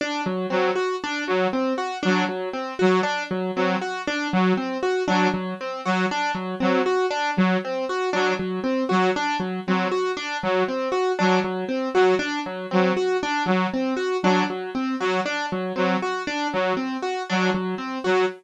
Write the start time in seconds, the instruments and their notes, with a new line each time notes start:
0.01 acoustic grand piano D4
0.26 acoustic grand piano F#3
0.50 lead 2 (sawtooth) F#3, acoustic grand piano C4
0.75 acoustic grand piano F#4
1.04 acoustic grand piano D4
1.27 lead 2 (sawtooth) F#3, acoustic grand piano F#3
1.53 acoustic grand piano C4
1.78 acoustic grand piano F#4
2.03 lead 2 (sawtooth) F#3, acoustic grand piano D4
2.29 acoustic grand piano F#3
2.53 acoustic grand piano C4
2.79 lead 2 (sawtooth) F#3, acoustic grand piano F#4
3.03 acoustic grand piano D4
3.31 acoustic grand piano F#3
3.56 lead 2 (sawtooth) F#3, acoustic grand piano C4
3.81 acoustic grand piano F#4
4.07 acoustic grand piano D4
4.33 lead 2 (sawtooth) F#3, acoustic grand piano F#3
4.57 acoustic grand piano C4
4.83 acoustic grand piano F#4
5.08 lead 2 (sawtooth) F#3, acoustic grand piano D4
5.34 acoustic grand piano F#3
5.61 acoustic grand piano C4
5.85 lead 2 (sawtooth) F#3, acoustic grand piano F#4
6.11 acoustic grand piano D4
6.35 acoustic grand piano F#3
6.60 lead 2 (sawtooth) F#3, acoustic grand piano C4
6.86 acoustic grand piano F#4
7.10 acoustic grand piano D4
7.37 lead 2 (sawtooth) F#3, acoustic grand piano F#3
7.65 acoustic grand piano C4
7.89 acoustic grand piano F#4
8.13 lead 2 (sawtooth) F#3, acoustic grand piano D4
8.39 acoustic grand piano F#3
8.64 acoustic grand piano C4
8.89 lead 2 (sawtooth) F#3, acoustic grand piano F#4
9.16 acoustic grand piano D4
9.40 acoustic grand piano F#3
9.67 lead 2 (sawtooth) F#3, acoustic grand piano C4
9.91 acoustic grand piano F#4
10.17 acoustic grand piano D4
10.43 lead 2 (sawtooth) F#3, acoustic grand piano F#3
10.68 acoustic grand piano C4
10.92 acoustic grand piano F#4
11.19 lead 2 (sawtooth) F#3, acoustic grand piano D4
11.44 acoustic grand piano F#3
11.69 acoustic grand piano C4
11.94 lead 2 (sawtooth) F#3, acoustic grand piano F#4
12.19 acoustic grand piano D4
12.46 acoustic grand piano F#3
12.71 lead 2 (sawtooth) F#3, acoustic grand piano C4
12.97 acoustic grand piano F#4
13.23 acoustic grand piano D4
13.46 acoustic grand piano F#3, lead 2 (sawtooth) F#3
13.74 acoustic grand piano C4
13.97 acoustic grand piano F#4
14.23 lead 2 (sawtooth) F#3, acoustic grand piano D4
14.50 acoustic grand piano F#3
14.75 acoustic grand piano C4
15.00 lead 2 (sawtooth) F#3, acoustic grand piano F#4
15.26 acoustic grand piano D4
15.52 acoustic grand piano F#3
15.76 lead 2 (sawtooth) F#3, acoustic grand piano C4
16.02 acoustic grand piano F#4
16.27 acoustic grand piano D4
16.53 lead 2 (sawtooth) F#3, acoustic grand piano F#3
16.77 acoustic grand piano C4
17.02 acoustic grand piano F#4
17.30 lead 2 (sawtooth) F#3, acoustic grand piano D4
17.54 acoustic grand piano F#3
17.78 acoustic grand piano C4
18.04 lead 2 (sawtooth) F#3, acoustic grand piano F#4